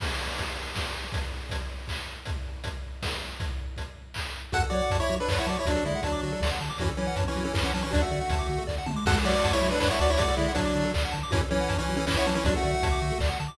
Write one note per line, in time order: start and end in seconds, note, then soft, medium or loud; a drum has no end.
0.00 kick loud
0.00 crash loud
0.38 kick medium
0.38 closed hi-hat loud
0.75 kick medium
0.75 snare loud
1.12 kick loud
1.12 closed hi-hat loud
1.49 kick medium
1.49 closed hi-hat loud
1.87 kick medium
1.87 clap loud
2.25 kick loud
2.25 closed hi-hat loud
2.64 kick medium
2.64 closed hi-hat loud
3.03 kick medium
3.03 snare loud
3.40 kick loud
3.40 closed hi-hat loud
3.76 kick medium
3.76 closed hi-hat medium
4.14 kick medium
4.14 clap loud
4.52 4.63 F#2 medium
4.52 4.61 F#4 medium
4.52 4.63 A4 loud
4.52 4.63 F#5 loud
4.52 kick loud
4.52 closed hi-hat loud
4.63 4.72 A4 medium
4.70 4.82 F#3 medium
4.70 4.97 F#4 medium
4.70 4.81 C#5 medium
4.70 4.97 D5 medium
4.82 4.91 F#5 medium
4.90 5.01 F#2 medium
4.90 5.00 A5 medium
4.90 kick medium
4.90 closed hi-hat loud
5.00 5.15 E4 medium
5.00 5.15 C#5 loud
5.00 5.08 C#6 medium
5.09 5.20 F#3 medium
5.09 5.18 F#4 medium
5.20 5.29 D4 medium
5.20 5.29 A4 medium
5.20 5.29 B4 medium
5.28 5.39 F#2 medium
5.28 5.38 D4 medium
5.28 5.38 B4 medium
5.28 5.37 C#5 medium
5.28 kick medium
5.28 clap loud
5.38 5.47 E4 medium
5.38 5.47 C#5 medium
5.38 5.46 F#5 medium
5.46 5.57 F#3 medium
5.46 5.58 F#4 medium
5.46 5.58 D5 medium
5.46 5.54 A5 medium
5.57 5.68 E4 medium
5.57 5.68 C#5 medium
5.57 5.65 C#6 medium
5.66 5.76 D2 medium
5.66 5.84 F#3 medium
5.66 5.84 D4 medium
5.66 5.75 F#4 medium
5.66 kick medium
5.66 closed hi-hat loud
5.76 5.84 A4 medium
5.85 5.95 D3 medium
5.85 6.01 G#3 medium
5.85 6.01 E4 medium
5.85 5.94 D5 medium
5.95 6.04 F#5 medium
6.02 6.14 D2 medium
6.02 6.42 F#3 medium
6.02 6.42 D4 medium
6.02 6.12 A5 medium
6.02 kick medium
6.02 closed hi-hat loud
6.12 6.21 D6 medium
6.23 6.33 D3 medium
6.23 6.32 F#4 medium
6.32 6.41 A4 medium
6.40 6.52 D2 medium
6.40 6.51 D5 medium
6.40 kick medium
6.40 snare loud
6.51 6.60 F#5 medium
6.60 6.71 D3 medium
6.60 6.69 A5 medium
6.70 6.78 D6 medium
6.78 6.90 F#2 medium
6.78 6.90 E3 medium
6.78 6.90 C#4 medium
6.78 6.89 F#4 medium
6.78 kick loud
6.78 closed hi-hat loud
6.89 6.97 A4 medium
6.97 7.24 E3 medium
6.97 7.09 F#3 medium
6.97 7.24 C#4 medium
6.97 7.07 C#5 medium
7.07 7.16 F#5 medium
7.16 7.27 F#2 medium
7.16 7.25 A5 medium
7.16 kick medium
7.16 closed hi-hat loud
7.28 7.43 E3 medium
7.28 7.43 C#4 medium
7.28 7.36 C#6 medium
7.36 7.46 F#3 medium
7.36 7.45 F#4 medium
7.44 7.53 E3 medium
7.44 7.53 C#4 medium
7.44 7.53 A4 medium
7.53 7.65 F#2 medium
7.53 7.62 E3 medium
7.53 7.62 C#4 medium
7.53 7.62 C#5 medium
7.53 kick loud
7.53 clap loud
7.63 7.72 E3 medium
7.63 7.72 C#4 medium
7.63 7.73 F#5 medium
7.74 7.83 E3 medium
7.74 7.84 F#3 medium
7.74 7.83 C#4 medium
7.74 7.83 A5 medium
7.83 7.93 E3 medium
7.83 7.93 C#4 medium
7.83 7.91 C#6 medium
7.91 8.04 D2 medium
7.91 8.02 F#3 medium
7.91 8.02 D4 loud
7.91 7.99 F#4 medium
7.91 kick loud
7.91 closed hi-hat loud
8.02 8.64 A3 medium
8.02 8.64 F#4 medium
8.02 8.11 A4 medium
8.11 8.22 D3 medium
8.11 8.20 D5 medium
8.21 8.30 F#5 medium
8.30 8.41 D2 medium
8.30 8.40 A5 medium
8.30 kick medium
8.30 closed hi-hat loud
8.39 8.47 D6 medium
8.49 8.59 D3 medium
8.49 8.58 F#4 medium
8.58 8.67 A4 medium
8.67 8.79 D2 medium
8.67 8.76 D5 medium
8.67 kick medium
8.67 snare medium
8.78 8.87 F#5 medium
8.86 8.97 D3 medium
8.86 8.95 A5 medium
8.86 mid tom loud
8.96 9.05 D6 medium
9.06 9.16 F#2 medium
9.06 9.15 F#4 medium
9.06 9.16 A4 loud
9.06 9.16 F#5 loud
9.06 kick loud
9.06 crash loud
9.15 9.24 A4 medium
9.23 9.35 F#3 medium
9.23 9.52 F#4 medium
9.23 9.32 C#5 medium
9.23 9.52 D5 loud
9.34 9.43 F#5 medium
9.43 9.54 F#2 medium
9.43 9.53 A5 medium
9.43 kick loud
9.43 closed hi-hat loud
9.53 9.68 E4 loud
9.53 9.68 C#5 loud
9.53 9.61 C#6 medium
9.62 9.72 F#3 medium
9.62 9.70 F#4 medium
9.71 9.79 D4 medium
9.71 9.80 A4 medium
9.71 9.79 B4 loud
9.80 9.92 F#2 medium
9.80 9.89 D4 medium
9.80 9.89 B4 loud
9.80 9.89 C#5 medium
9.80 kick medium
9.80 clap loud
9.89 10.00 E4 medium
9.89 10.00 C#5 loud
9.89 9.98 F#5 medium
9.99 10.29 D2 medium
9.99 10.10 F#4 medium
9.99 10.10 D5 medium
9.99 10.07 A5 medium
10.10 10.19 E4 medium
10.10 10.19 C#5 loud
10.10 10.20 C#6 medium
10.17 10.35 F#4 loud
10.17 10.28 F#4 medium
10.17 10.35 D5 loud
10.17 kick loud
10.17 closed hi-hat loud
10.28 10.36 A4 medium
10.37 10.48 D3 medium
10.37 10.52 G#3 medium
10.37 10.52 E4 medium
10.37 10.47 D5 medium
10.48 10.57 F#5 medium
10.55 10.67 D2 medium
10.55 10.92 F#3 medium
10.55 10.92 D4 medium
10.55 10.64 A5 medium
10.55 kick medium
10.55 closed hi-hat loud
10.65 10.74 D6 medium
10.75 10.85 D3 medium
10.75 10.84 F#4 medium
10.85 10.93 A4 medium
10.94 11.05 D2 medium
10.94 11.03 D5 medium
10.94 kick medium
10.94 clap loud
11.05 11.14 F#5 medium
11.12 11.24 D3 medium
11.12 11.20 A5 medium
11.23 11.32 D6 medium
11.31 11.42 F#2 medium
11.31 11.42 E3 loud
11.31 11.42 C#4 loud
11.31 11.39 F#4 medium
11.31 kick loud
11.31 closed hi-hat loud
11.41 11.49 A4 medium
11.51 11.77 E3 medium
11.51 11.62 F#3 medium
11.51 11.77 C#4 loud
11.51 11.60 C#5 medium
11.61 11.69 F#5 medium
11.69 11.80 F#2 medium
11.69 11.78 A5 medium
11.69 kick medium
11.69 closed hi-hat loud
11.78 11.96 E3 medium
11.78 11.96 C#4 loud
11.78 11.87 C#6 medium
11.88 11.99 F#3 medium
11.88 11.98 F#4 medium
11.97 12.06 E3 medium
11.97 12.06 C#4 loud
11.97 12.07 A4 medium
12.07 12.18 F#2 medium
12.07 12.16 E3 medium
12.07 12.16 C#4 loud
12.07 12.17 C#5 medium
12.07 kick medium
12.07 clap loud
12.17 12.26 E4 loud
12.17 12.26 C#5 loud
12.17 12.27 F#5 medium
12.26 12.35 E3 medium
12.26 12.37 F#3 medium
12.26 12.35 C#4 medium
12.26 12.35 A5 medium
12.35 12.44 E3 loud
12.35 12.44 C#4 loud
12.35 12.45 C#6 medium
12.45 12.55 D2 medium
12.45 12.55 F#3 loud
12.45 12.55 D4 loud
12.45 12.55 F#4 medium
12.45 kick loud
12.45 closed hi-hat loud
12.54 13.18 A3 medium
12.54 13.18 F#4 loud
12.54 12.62 A4 medium
12.63 12.75 D3 medium
12.63 12.72 D5 medium
12.75 12.83 F#5 medium
12.83 12.93 D2 medium
12.83 12.91 A5 medium
12.83 kick loud
12.83 closed hi-hat loud
12.92 13.00 D6 medium
13.02 13.12 D3 medium
13.02 13.10 F#4 medium
13.12 13.21 A4 medium
13.20 13.31 D2 medium
13.20 13.29 D5 medium
13.20 kick loud
13.20 clap loud
13.30 13.38 F#5 medium
13.40 13.50 D3 medium
13.40 13.48 A5 medium
13.48 13.57 D6 medium